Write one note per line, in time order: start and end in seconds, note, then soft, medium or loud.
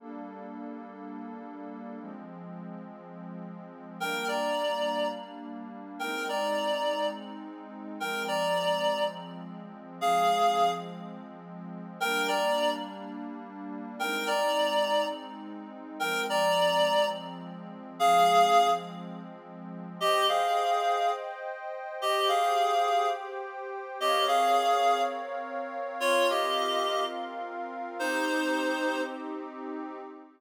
0.00 1.98 G3 medium
0.00 1.98 A#3 medium
0.00 1.98 D4 medium
0.00 1.98 A4 medium
2.00 3.98 F3 medium
2.00 3.98 G#3 medium
2.00 3.98 C4 medium
4.00 5.98 G3 medium
4.00 5.98 A#3 medium
4.00 5.98 D4 medium
4.00 4.27 A#4 medium
4.00 4.27 G5 medium
4.28 5.08 D5 medium
4.28 5.08 A#5 medium
5.99 7.98 G#3 medium
5.99 7.98 C4 medium
5.99 7.98 D#4 medium
5.99 6.27 A#4 medium
5.99 6.27 G5 medium
6.29 7.06 D5 medium
6.29 7.06 A#5 medium
8.00 9.98 F3 medium
8.00 9.98 G#3 medium
8.00 9.98 C4 medium
8.00 8.23 A#4 medium
8.00 8.23 G5 medium
8.28 9.04 D5 medium
8.28 9.04 A#5 medium
10.00 11.98 F3 medium
10.00 11.98 G#3 medium
10.00 11.98 C4 medium
10.00 10.71 G#4 medium
10.00 10.71 F5 medium
12.00 13.98 G3 medium
12.00 13.98 A#3 medium
12.00 13.98 D4 medium
12.00 12.27 A#4 medium
12.00 12.27 G5 medium
12.28 12.71 D5 medium
12.28 12.71 A#5 medium
13.99 15.98 G#3 medium
13.99 15.98 C4 medium
13.99 15.98 D#4 medium
13.99 14.27 A#4 medium
13.99 14.27 G5 medium
14.27 15.05 D5 medium
14.27 15.05 A#5 medium
16.00 17.98 F3 medium
16.00 17.98 G#3 medium
16.00 17.98 C4 medium
16.00 16.23 A#4 medium
16.00 16.23 G5 medium
16.30 17.06 D5 medium
16.30 17.06 A#5 medium
17.99 19.98 F3 medium
17.99 19.98 G#3 medium
17.99 19.98 C4 medium
17.99 18.69 G#4 medium
17.99 18.69 F5 medium
20.00 20.27 G4 medium
20.00 21.98 C5 medium
20.00 21.98 D#5 medium
20.00 20.27 D#5 medium
20.00 21.98 G5 medium
20.29 21.11 G#4 medium
20.29 21.11 F5 medium
22.00 23.98 G4 medium
22.00 22.28 G4 medium
22.00 23.98 C5 medium
22.00 22.28 D#5 medium
22.00 23.98 G5 medium
22.28 23.08 G#4 medium
22.28 23.08 F5 medium
24.00 25.98 C4 medium
24.00 24.25 G4 medium
24.00 25.98 A#4 medium
24.00 25.98 C#5 loud
24.00 24.25 D#5 medium
24.00 25.98 F5 medium
24.28 25.01 G#4 medium
24.28 25.01 F5 medium
26.00 27.98 C4 medium
26.00 27.98 F4 medium
26.00 26.27 F4 medium
26.00 27.98 A#4 medium
26.00 26.27 C#5 medium
26.00 27.98 F5 medium
26.30 27.04 G4 medium
26.30 27.04 D#5 medium
27.99 29.98 C4 medium
27.99 29.01 D#4 medium
27.99 29.98 D#4 medium
27.99 29.98 G4 medium
27.99 29.01 C5 medium